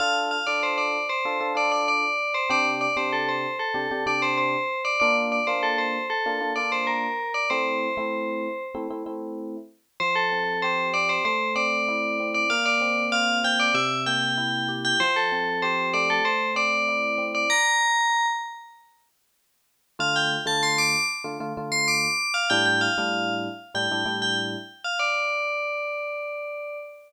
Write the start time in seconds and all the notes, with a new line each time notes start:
0.00 D4 F4 A4 F5
0.31 F5
0.47 D4 F4 A4 D5
0.63 C5
0.78 D5
1.09 C5
1.25 D4 F4 A4
1.40 D4 F4 A4
1.55 D4 F4 A4 D5
1.72 D5
1.88 D5
2.34 C5
2.50 C3 D4 G4 D5
2.81 D5
2.96 C3 D4 G4 C5
3.12 A4
3.29 C5
3.59 A4
3.74 C3 D4 G4
3.91 C3 D4 G4
4.06 C3 D4 G4 D5
4.22 C5
4.38 C5
4.85 D5
5.00 A#3 D4 F4 D5
5.32 D5
5.47 A#3 D4 F4 C5
5.63 A4
5.78 C5
6.10 A4
6.26 A#3 D4 F4
6.40 A#3 D4 F4
6.56 A#3 D4 F4 D5
6.72 C5
6.87 A#4
7.34 D5
7.50 A3 C4 E4 C5
7.97 A3 C4 E4
8.75 A3 C4 E4
8.90 A3 C4 E4
9.06 A3 C4 E4
10.00 F3 C5
10.15 A4
10.32 C4
10.62 G4 C5
10.93 C4 D5
11.09 C5
11.25 A3 C5
11.55 C4 D5
11.88 E4
12.20 C4
12.34 D5
12.50 A#3 F5
12.66 D5
12.81 C4
13.12 F4 F5
13.44 C4 G5
13.60 D5
13.74 C3 E5
14.06 A#3 G5
14.37 E4
14.68 G4
14.85 G5
15.00 F3 C5
15.16 A4
15.32 C4
15.62 G4 C5
15.93 A3 D5
16.10 A4
16.25 C5
16.55 C4 D5
16.88 E4
17.18 C4
17.35 D5
17.50 A#5
19.99 D3 A3 F4 F5
20.16 G5
20.46 D3 A3 F4 A5
20.63 C6
20.78 D6
21.24 D3 A3 F4
21.40 D3 A3 F4
21.57 D3 A3 F4
21.72 C6
21.88 D6
22.34 F5
22.50 A2 G3 D4 E4 G5
22.66 G5
22.81 F5
22.98 A2 G3 D4 E4
23.74 A2 G3 D4 E4 G5
23.91 A2 G3 D4 E4
24.05 A2 G3 D4 E4
24.22 G5
24.84 F5
24.99 D5